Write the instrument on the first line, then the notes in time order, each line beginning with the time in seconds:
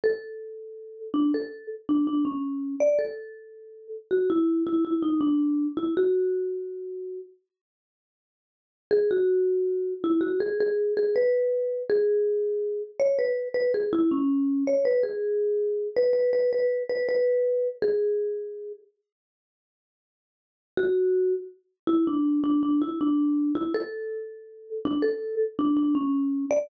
marimba
0.04 A4
1.14 D4
1.34 A4
1.89 D4
2.07 D4
2.25 C#4
2.80 D5
2.99 A4
4.11 F#4
4.30 E4
4.67 E4
4.85 E4
5.02 D#4
5.21 D4
5.77 E4
5.97 F#4
8.91 G#4
9.11 F#4
10.04 E4
10.21 F#4
10.40 G#4
10.60 G#4
10.97 G#4
11.16 B4
11.90 G#4
13.00 C#5
13.19 B4
13.54 B4
13.74 G#4
13.93 E4
14.11 C#4
14.67 C#5
14.85 B4
15.03 G#4
15.97 B4
16.13 B4
16.33 B4
16.53 B4
16.90 B4
17.09 B4
17.82 G#4
20.77 F#4
21.87 E4
22.07 D4
22.44 D4
22.63 D4
22.82 E4
23.01 D4
23.55 E4
23.74 A4
24.85 D4
25.02 A4
25.59 D4
25.77 D4
25.95 C#4
26.51 D5